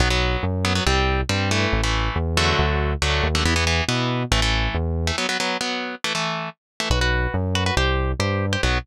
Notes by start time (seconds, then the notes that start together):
0.00 B1 F#3 B3
0.10 F#3 B3
0.43 F#2
0.65 F#3 B3
0.75 F#3 B3
0.86 C2 G3 C4
1.29 G2 G3 C4
1.51 E3 A3
1.73 A1
1.84 E3 A3
2.16 E2
2.37 D3 F#3 A3
2.59 D2
3.02 D2 D3 F#3 A3
3.24 D#2
3.35 D3 F#3 A3
3.45 E2 E3 B3
3.56 E3 B3
3.67 E3 B3
3.88 B2 E3 B3
4.31 A1 E3 A3
4.42 E3 A3
4.74 E2
5.07 E3 A3
5.18 F#3 B3
5.29 F#3 B3
5.40 F#3 B3
5.61 F#3 B3
6.04 E3 A3
6.15 E3 A3
6.80 E3 A3
6.90 B1 F#4 B4
7.01 F#4 B4
7.34 F#2
7.55 F#4 B4
7.66 F#4 B4
7.77 C2 G4 C5
8.19 G2 G4 C5
8.53 G4 C5
8.63 B1 F#3 B3